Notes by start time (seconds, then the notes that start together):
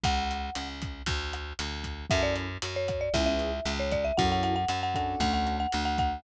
0.03 C#2 F#5, kick, closed hi-hat
0.31 closed hi-hat
0.55 C#2, cross-stick, closed hi-hat
0.82 kick, closed hi-hat
1.06 D2, kick, closed hi-hat
1.33 cross-stick, closed hi-hat
1.59 D2, closed hi-hat
1.84 kick, closed hi-hat
2.10 F#2 C#4 E4 F#4 A4 E5, kick, cross-stick, closed hi-hat
2.23 D5
2.36 closed hi-hat
2.62 F#2, closed hi-hat
2.76 C#5
2.88 kick, cross-stick, closed hi-hat
3.01 D5
3.14 C#2 B3 C#4 E4 G#4 E5, kick, closed hi-hat
3.26 E5
3.39 closed hi-hat
3.65 C#2, cross-stick, closed hi-hat
3.80 C#5
3.91 D5, kick, closed hi-hat
4.04 E5
4.17 F#2 C#4 E4 F#4 A4 F#5, kick, closed hi-hat
4.32 F#5
4.43 F#5, closed hi-hat
4.56 F#5
4.68 F#2, cross-stick, closed hi-hat
4.83 F#5
4.94 C#4 D4 F#4 A4 F#5, kick, closed hi-hat
5.20 D2 F#5, kick, closed hi-hat
5.34 F#5
5.47 cross-stick, closed hi-hat
5.60 F#5
5.72 D2, closed hi-hat
5.85 F#5
5.98 F#5, kick, closed hi-hat